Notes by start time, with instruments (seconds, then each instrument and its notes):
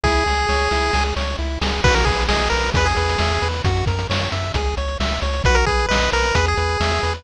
0.03 synth bass 1 C#2, lead 1 (square) E4 G#4, kick, snare
0.26 synth bass 1 C#2, lead 1 (square) G#4, snare
0.49 synth bass 1 C#2, lead 1 (square) C#5, snare
0.71 synth bass 1 C#2, lead 1 (square) E4, snare
0.93 synth bass 1 C#2, lead 1 (square) G#4, snare
1.16 synth bass 1 C#2, lead 1 (square) C#5, snare
1.39 synth bass 1 C#2, lead 1 (square) E4
1.61 synth bass 1 C#2, lead 1 (square) G#4, snare
1.84 synth bass 1 B1, lead 1 (square) F#4 B4, kick, crash
1.94 lead 1 (square) A#4, closed hi-hat
2.05 synth bass 1 B1, lead 1 (square) G#4 B4, kick, closed hi-hat
2.19 closed hi-hat
2.28 synth bass 1 B1, lead 1 (square) G#4 D#5, snare
2.39 closed hi-hat
2.50 synth bass 1 B1, lead 1 (square) A#4 B4, closed hi-hat
2.63 closed hi-hat
2.74 synth bass 1 E2, lead 1 (square) G#4 B4, kick, closed hi-hat
2.85 lead 1 (square) G#4, closed hi-hat
2.96 synth bass 1 E2, lead 1 (square) B4, closed hi-hat
3.09 closed hi-hat
3.18 synth bass 1 E2, lead 1 (square) E5, snare
3.30 closed hi-hat
3.42 synth bass 1 E2, lead 1 (square) B4, closed hi-hat
3.54 closed hi-hat
3.64 synth bass 1 F#2, lead 1 (square) F#4, kick, closed hi-hat
3.77 closed hi-hat
3.86 synth bass 1 F#2, lead 1 (square) A#4, kick, closed hi-hat
3.99 closed hi-hat
4.10 synth bass 1 F#2, lead 1 (square) C#5, snare
4.20 closed hi-hat
4.32 synth bass 1 F#2, lead 1 (square) E5, closed hi-hat
4.44 closed hi-hat
4.54 synth bass 1 C#2, lead 1 (square) G#4, kick, closed hi-hat
4.65 closed hi-hat
4.77 synth bass 1 C#2, lead 1 (square) C#5, closed hi-hat
4.88 closed hi-hat
5.00 synth bass 1 C#2, lead 1 (square) E5, snare
5.11 closed hi-hat
5.22 synth bass 1 C#2, lead 1 (square) C#5, closed hi-hat
5.33 closed hi-hat
5.44 synth bass 1 B1, lead 1 (square) F#4 B4, kick, closed hi-hat
5.55 lead 1 (square) A#4, closed hi-hat
5.66 synth bass 1 B1, lead 1 (square) G#4 B4, kick, closed hi-hat
5.79 closed hi-hat
5.88 synth bass 1 B1, lead 1 (square) B4 D#5, snare
6.02 closed hi-hat
6.12 synth bass 1 B1, lead 1 (square) A#4 B4, closed hi-hat
6.23 closed hi-hat
6.35 synth bass 1 E2, lead 1 (square) G#4 B4, kick, closed hi-hat
6.45 lead 1 (square) G#4, closed hi-hat
6.57 synth bass 1 E2, lead 1 (square) B4, closed hi-hat
6.69 closed hi-hat
6.80 synth bass 1 E2, lead 1 (square) E5, snare
6.91 closed hi-hat
7.03 synth bass 1 E2, lead 1 (square) B4, closed hi-hat
7.14 closed hi-hat